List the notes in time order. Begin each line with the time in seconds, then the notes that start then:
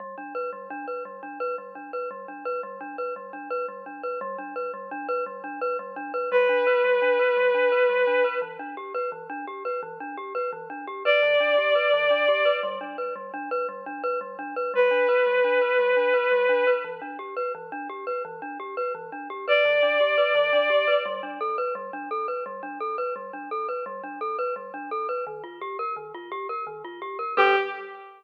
0.00 G3
0.18 D4
0.35 B4
0.53 G3
0.70 D4
0.88 B4
1.05 G3
1.23 D4
1.40 B4
1.58 G3
1.75 D4
1.93 B4
2.11 G3
2.28 D4
2.45 B4
2.63 G3
2.81 D4
2.98 B4
3.16 G3
3.33 D4
3.50 B4
3.68 G3
3.86 D4
4.03 B4
4.21 G3
4.38 D4
4.56 B4
4.74 G3
4.91 D4
5.09 B4
5.26 G3
5.44 D4
5.61 B4
5.79 G3
5.96 D4
6.14 B4
6.31 G3 B4
6.49 D4
6.67 B4
6.84 G3
7.02 D4
7.19 B4
7.37 G3
7.54 D4
7.72 B4
7.89 G3
8.07 D4
8.24 B4
8.42 E3
8.59 D4
8.77 G4
8.94 B4
9.12 E3
9.30 D4
9.47 G4
9.65 B4
9.83 E3
10.00 D4
10.17 G4
10.35 B4
10.53 E3
10.70 D4
10.87 G4
11.05 B4 D5
11.23 E3
11.40 D4
11.58 G4
11.75 B4
11.93 E3
12.10 D4
12.28 G4
12.45 B4
12.63 G3
12.81 D4
12.98 B4
13.16 G3
13.34 D4
13.51 B4
13.69 G3
13.86 D4
14.04 B4
14.21 G3
14.39 D4
14.56 B4
14.74 G3 B4
14.91 D4
15.09 B4
15.26 G3
15.44 D4
15.61 B4
15.79 G3
15.97 D4
16.14 B4
16.32 G3
16.49 D4
16.67 B4
16.84 E3
17.02 D4
17.19 G4
17.37 B4
17.55 E3
17.72 D4
17.89 G4
18.07 B4
18.25 E3
18.42 D4
18.60 G4
18.77 B4
18.95 E3
19.12 D4
19.30 G4
19.48 B4 D5
19.65 E3
19.83 D4
20.00 G4
20.18 B4
20.35 E3
20.53 D4
20.70 G4
20.88 B4
21.06 G3
21.23 D4
21.41 A4
21.58 B4
21.75 G3
21.93 D4
22.11 A4
22.28 B4
22.46 G3
22.63 D4
22.80 A4
22.98 B4
23.16 G3
23.33 D4
23.51 A4
23.69 B4
23.86 G3
24.04 D4
24.21 A4
24.39 B4
24.56 G3
24.74 D4
24.91 A4
25.09 B4
25.27 D#3
25.44 F4
25.61 G4
25.79 A#4
25.96 D#3
26.14 F4
26.32 G4
26.49 A#4
26.67 D#3
26.85 F4
27.02 G4
27.19 A#4
27.37 G3 D4 G4 A4 B4